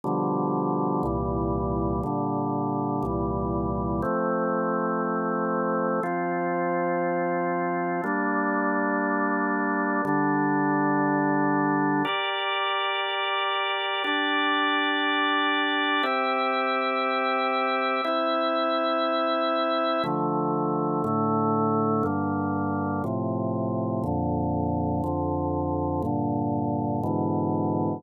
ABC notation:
X:1
M:4/4
L:1/8
Q:1/4=60
K:F
V:1 name="Drawbar Organ"
[=B,,D,F,G,]2 [C,,_B,,E,G,]2 [B,,D,G,]2 [C,,B,,E,G,]2 | [F,A,C]4 [F,CF]4 | [G,B,D]4 [D,G,D]4 | [GBd]4 [DGd]4 |
[CGe]4 [CEe]4 | [K:Dm] [D,F,A,]2 [A,,D,A,]2 [G,,D,B,]2 [A,,C,F,]2 | [F,,B,,D,]2 [F,,D,F,]2 [G,,B,,D,]2 [^G,,=B,,D,E,]2 |]